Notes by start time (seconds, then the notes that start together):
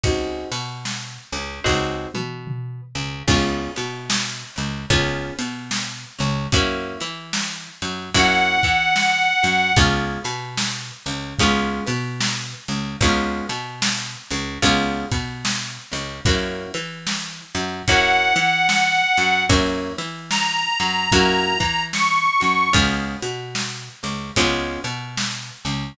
0.04 C#2 C4 D#4 F#4 G#4, kick, ride
0.52 B2 B3, ride
0.85 snare
1.32 C#2 C#3, ride
1.64 C#2 C4 D#4 F#4 G#4, kick, snare
2.14 B2 B3, high tom
2.47 mid tom
2.95 C#2 C#3
3.28 C#2 B3 C#4 F4 G#4, kick, crash
3.76 B2 B3, ride
4.10 snare
4.56 C#2 C#3, ride
4.90 C#2 B3 C#4 F4 G#4, kick, ride
5.39 B2 B3, ride
5.71 snare
6.19 C#2 C#3, ride
6.52 F#2 A#3 C#4 E4 F#4, kick, ride
7.00 E3 E4, ride
7.33 snare
7.82 F#2 F#3, ride
8.14 F#2 A#3 C#4 E4 F#4 F#5, kick, ride
8.63 E3 E4, kick, ride
8.96 snare
9.43 F#2 F#3, ride
9.76 C#2 G#3 B3 C#4 F4, kick, ride
10.24 B2 B3, ride
10.57 snare
11.06 C#2 C#3, ride
11.39 C#2 G#3 B3 C#4 F4, kick, ride
11.86 B2 B3, ride
12.21 snare
12.68 C#2 C#3, ride
13.01 C#2 G#3 B3 C#4 F4, kick, ride
13.49 B2 B3, ride
13.82 snare
14.30 C#2 C#3, ride
14.62 C#2 G#3 B3 C#4 F4, kick, ride
15.11 B2 B3, kick, ride
15.45 snare
15.92 C#2 C#3, ride
16.25 F#2 A#3 C#4 E4 F#4, kick, ride
16.74 E3 E4, ride
17.07 snare
17.55 F#2 F#3, ride
17.87 F#2 A#3 C#4 E4 F#4 F#5, kick, ride
18.36 E3 E4, ride
18.69 snare
19.17 F#2 F#3, ride
19.49 F#2 A#3 C#4 E4 F#4, kick, ride
19.98 E3 E4, ride
20.30 A#5, snare
20.80 F#2 F#3, ride
21.12 F#2 A#3 C#4 E4 F#4, kick, ride
21.60 E3 E4, kick, ride
21.93 C#6, snare
22.40 F#2 F#3, ride
22.73 C#2 G#3 B3 C#4 F4, kick, ride
23.22 B2 B3, ride
23.55 snare
24.03 C#2 C#3, ride
24.36 C#2 G#3 B3 C#4 F4, kick, ride
24.84 B2 B3, ride
25.17 snare
25.65 C#2 C#3, ride